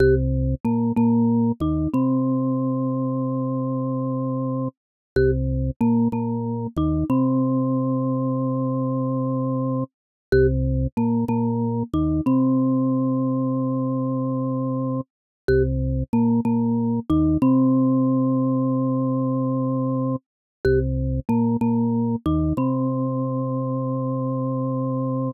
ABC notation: X:1
M:4/4
L:1/16
Q:1/4=93
K:Cphr
V:1 name="Marimba"
G z3 B,2 B,4 E2 C4- | C16 | G z3 B,2 B,4 E2 C4- | C16 |
G z3 B,2 B,4 E2 C4- | C16 | G z3 B,2 B,4 E2 C4- | C16 |
G z3 B,2 B,4 E2 C4- | C16 |]
V:2 name="Drawbar Organ" clef=bass
C,,4 B,,2 B,,4 E,,2 C,4- | C,16 | C,,4 B,,2 B,,4 E,,2 C,4- | C,16 |
C,,4 B,,2 B,,4 E,,2 C,4- | C,16 | C,,4 B,,2 B,,4 E,,2 C,4- | C,16 |
C,,4 B,,2 B,,4 E,,2 C,4- | C,16 |]